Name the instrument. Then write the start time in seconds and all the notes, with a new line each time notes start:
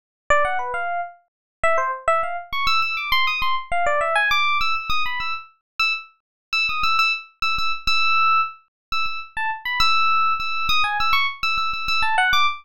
electric piano 1
0.30 D5
0.45 F#5
0.59 B4
0.74 F5
1.63 E5
1.78 C5
2.08 E5
2.23 F5
2.53 C#6
2.67 E6
2.82 E6
2.97 D6
3.12 C6
3.27 D#6
3.42 C6
3.72 F5
3.86 D5
4.01 E5
4.15 G#5
4.31 D6
4.61 E6
4.75 E6
4.90 D#6
5.06 B5
5.20 E6
5.79 E6
6.53 E6
6.69 D#6
6.83 E6
6.99 E6
7.42 E6
7.58 E6
7.87 E6
8.92 E6
9.06 E6
9.37 A5
9.65 B5
9.80 E6
10.40 E6
10.69 D#6
10.84 G#5
11.00 E6
11.13 C#6
11.43 E6
11.58 E6
11.73 E6
11.88 E6
12.02 A5
12.18 F#5
12.33 D6